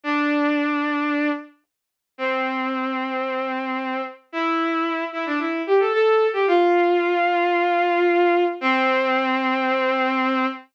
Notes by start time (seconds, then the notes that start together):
0.03 D4
2.18 C4
4.32 E4
5.12 E4
5.26 D4
5.39 E4
5.67 G4
5.80 A4
5.93 A4
6.33 G4
6.47 F4
8.61 C4